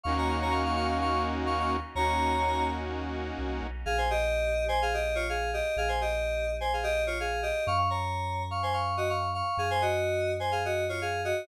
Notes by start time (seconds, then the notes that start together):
0.04 D#2 A#3 C#4 D#4 F#4 F5 C#6
0.18 C#5 A#5
0.28 F5 C#6
0.42 C#5 A#5
0.51 F5 C#6
0.65 F5 C#6
0.76 F5 C#6
0.87 F5 C#6
1.01 F5 C#6
1.46 F5 C#6
1.60 F5 C#6
1.95 D#2 A#3 C#4 D#4 F#4 C#5 A#5
3.38 C2
3.62 B1
3.86 A#1 G#4 F5
3.98 C5 G#5
4.10 G4 D#5
4.68 C5 G#5
4.82 G#4 F5
4.94 G4 D#5
5.15 F4 C#5
5.29 G#4 F5
5.53 G4 D#5
5.76 A#1 G#4 F5
5.88 C5 G#5
6.01 G4 D#5
6.61 C5 G#5
6.73 G#4 F5
6.83 G4 D#5
7.07 F4 C#5
7.20 G#4 F5
7.42 G4 D#5
7.67 F#2 F5 C#6
7.77 F5 C#6
7.90 C#5 A#5
8.51 F5 C#6
8.63 C5 G#5
8.73 F5 C#6
8.97 F#4 D#5
9.10 F5 C#6
9.34 F5 C#6
9.57 F#2 G#4 F5
9.71 C5 G#5
9.82 F#4 D#5
10.40 C5 G#5
10.52 G#4 F5
10.65 F#4 D#5
10.89 F4 C#5
11.01 G#4 F5
11.25 F#4 D#5